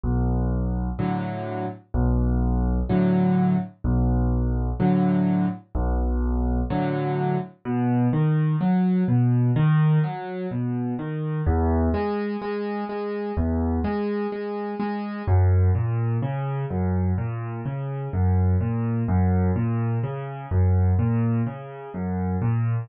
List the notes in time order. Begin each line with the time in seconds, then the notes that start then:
0.04 B1
0.99 A2 D3 F#3
1.94 B1
2.89 A2 D3 F#3
3.84 B1
4.80 A2 D3 F#3
5.75 B1
6.70 A2 D3 F#3
7.65 B2
8.13 D#3
8.61 F#3
9.08 B2
9.56 D#3
10.04 F#3
10.51 B2
10.99 D#3
11.46 E2
11.94 G#3
12.42 G#3
12.89 G#3
13.37 E2
13.84 G#3
14.32 G#3
14.80 G#3
15.28 F#2
15.75 A#2
16.22 C#3
16.70 F#2
17.18 A#2
17.65 C#3
18.13 F#2
18.61 A#2
19.08 F#2
19.56 A#2
20.03 C#3
20.51 F#2
20.99 A#2
21.46 C#3
21.94 F#2
22.42 A#2